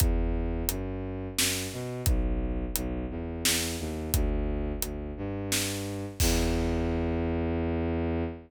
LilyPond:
<<
  \new Staff \with { instrumentName = "Violin" } { \clef bass \time 3/4 \key e \minor \tempo 4 = 87 e,4 fis,4 fis,8 b,8 | b,,4 b,,8 e,8 e,8 dis,8 | d,4 d,8 g,4. | e,2. | }
  \new DrumStaff \with { instrumentName = "Drums" } \drummode { \time 3/4 <hh bd>4 hh4 sn4 | <hh bd>4 hh4 sn4 | <hh bd>4 hh4 sn4 | <cymc bd>4 r4 r4 | }
>>